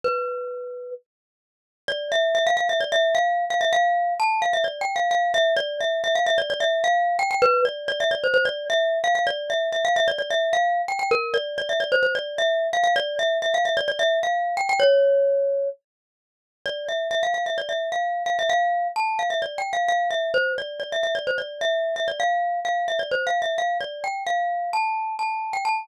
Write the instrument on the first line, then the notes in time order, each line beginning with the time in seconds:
glockenspiel
0.04 B4
1.88 D5
2.12 E5
2.35 E5
2.47 F5
2.57 F5
2.69 E5
2.80 D5
2.92 E5
3.15 F5
3.50 F5
3.61 E5
3.73 F5
4.20 A5
4.42 F5
4.53 E5
4.64 D5
4.81 G5
4.96 F5
5.11 F5
5.34 E5
5.56 D5
5.80 E5
6.04 E5
6.15 F5
6.26 E5
6.38 D5
6.50 D5
6.60 E5
6.84 F5
7.19 G5
7.31 G5
7.42 B4
7.65 D5
7.88 D5
8.00 E5
8.11 D5
8.24 C5
8.34 C5
8.45 D5
8.70 E5
9.04 F5
9.15 F5
9.27 D5
9.50 E5
9.72 E5
9.85 F5
9.96 E5
10.08 D5
10.18 D5
10.30 E5
10.53 F5
10.88 G5
10.99 G5
11.11 A#4
11.34 D5
11.58 D5
11.69 E5
11.80 D5
11.92 C5
12.03 C5
12.15 D5
12.38 E5
12.73 F5
12.84 F5
12.96 D5
13.19 E5
13.42 E5
13.54 F5
13.65 E5
13.77 D5
13.88 D5
13.99 E5
14.23 F5
14.57 G5
14.69 G5
14.80 C#5
16.66 D5
16.88 E5
17.11 E5
17.23 F5
17.34 F5
17.46 E5
17.58 D5
17.69 E5
17.92 F5
18.26 F5
18.39 E5
18.49 F5
18.96 A5
19.19 F5
19.30 E5
19.42 D5
19.58 G5
19.73 F5
19.88 F5
20.10 E5
20.34 C5
20.58 D5
20.80 D5
20.92 E5
21.03 E5
21.15 D5
21.27 C5
21.38 D5
21.61 E5
21.96 E5
22.08 D5
22.20 F5
22.65 F5
22.88 E5
22.99 D5
23.11 C5
23.27 F5
23.42 E5
23.58 F5
23.80 D5
24.04 G5
24.26 F5
24.73 A5
25.19 A5
25.53 G5
25.65 A5